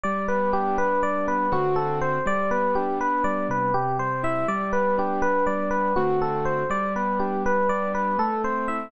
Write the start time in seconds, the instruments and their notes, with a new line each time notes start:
0.03 acoustic grand piano G3, electric piano 1 D5
0.28 acoustic grand piano B3, electric piano 1 B4
0.53 acoustic grand piano D4, electric piano 1 G4
0.78 acoustic grand piano B3, electric piano 1 B4
1.03 acoustic grand piano G3, electric piano 1 D5
1.27 acoustic grand piano B3, electric piano 1 B4
1.52 acoustic grand piano D3 A3 C4 F#4, electric piano 1 F#4
1.76 electric piano 1 A4
2.01 electric piano 1 C5
2.26 acoustic grand piano G3, electric piano 1 D5
2.51 acoustic grand piano B3, electric piano 1 B4
2.75 acoustic grand piano D4, electric piano 1 G4
3.00 acoustic grand piano B3, electric piano 1 B4
3.24 acoustic grand piano G3, electric piano 1 D5
3.49 acoustic grand piano C3, electric piano 1 B4
3.74 electric piano 1 G4
3.99 acoustic grand piano G3, electric piano 1 C5
4.23 acoustic grand piano E4, electric piano 1 E5
4.48 acoustic grand piano G3, electric piano 1 D5
4.72 acoustic grand piano B3, electric piano 1 B4
4.98 acoustic grand piano D4, electric piano 1 G4
5.22 acoustic grand piano B3, electric piano 1 B4
5.47 acoustic grand piano G3, electric piano 1 D5
5.71 acoustic grand piano B3, electric piano 1 B4
5.96 acoustic grand piano D3 A3 C4 F#4, electric piano 1 F#4
6.22 electric piano 1 A4
6.45 electric piano 1 C5
6.70 acoustic grand piano G3, electric piano 1 D5
6.96 acoustic grand piano B3, electric piano 1 B4
7.19 acoustic grand piano D4, electric piano 1 G4
7.45 acoustic grand piano B3, electric piano 1 B4
7.69 acoustic grand piano G3, electric piano 1 D5
7.94 acoustic grand piano B3, electric piano 1 B4
8.18 acoustic grand piano A3, electric piano 1 A4
8.44 acoustic grand piano C4, electric piano 1 C5
8.68 acoustic grand piano E4, electric piano 1 E5